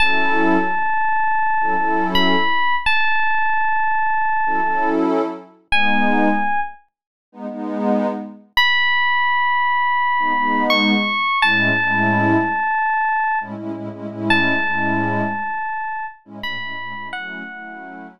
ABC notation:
X:1
M:4/4
L:1/16
Q:1/4=84
K:F#dor
V:1 name="Electric Piano 1"
a12 b4 | a12 z4 | g6 z10 | b12 c'4 |
a12 z4 | a12 b4 | f6 z10 |]
V:2 name="Pad 2 (warm)"
[F,CEA]9 [F,CEA] [F,CEA]6- | [F,CEA]9 [F,CEA] [F,CEA]6 | [G,B,D]9 [G,B,D] [G,B,D]6- | [G,B,D]9 [G,B,D] [G,B,D]6 |
[A,,G,CE]2 [A,,G,CE]9 [A,,G,CE] [A,,G,CE] [A,,G,CE] [A,,G,CE] [A,,G,CE]- | [A,,G,CE]2 [A,,G,CE]9 [A,,G,CE] [A,,G,CE] [A,,G,CE] [A,,G,CE] [A,,G,CE] | [F,A,CE]2 [F,A,CE]9 z5 |]